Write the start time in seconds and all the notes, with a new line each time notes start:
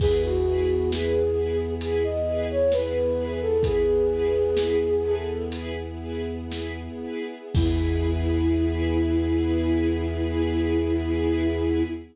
0.00 E2 B3 E4 G#4 B4, kick, crash
0.23 F#4
0.46 E4 G#4 B4
0.91 E4 G#4 B4, snare
1.36 E4 G#4 B4
1.81 E4 G#4 B4, closed hi-hat
2.04 D#5
2.27 E4 G#4 B4
2.50 C#5
2.72 E4 G#4 B4, snare
3.18 E4 G#4 B4
3.41 A4
3.63 E4 G#4 B4, kick, closed hi-hat
4.10 E4 G#4 B4
4.56 E4 G#4 B4, snare
5.04 E4 G#4 A4 B4
5.52 E4 G#4 B4, closed hi-hat
6.01 E4 G#4 B4
6.51 E4 G#4 B4, snare
7.03 E4 G#4 B4
7.55 E2 B3 E4 G#4 B4, kick, crash